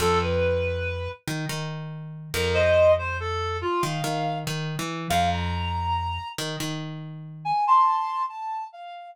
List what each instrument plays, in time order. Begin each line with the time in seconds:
0.00 electric bass (finger) F2, clarinet A4
0.22 clarinet B4
1.28 electric bass (finger) D#3
1.49 electric bass (finger) D#3
2.34 electric bass (finger) F2, clarinet A#4
2.54 clarinet C5 D#5
2.98 clarinet C5
3.20 clarinet A4
3.61 clarinet F4
3.82 electric bass (finger) D#3, clarinet F5
4.04 electric bass (finger) D#3
4.47 electric bass (finger) D#3
4.79 electric bass (finger) E3
5.10 electric bass (finger) F2, clarinet F5
5.32 clarinet A#5
6.38 electric bass (finger) D#3
6.60 electric bass (finger) D#3
7.45 clarinet G#5
7.67 clarinet A5 C6
8.29 clarinet A5
8.72 clarinet F5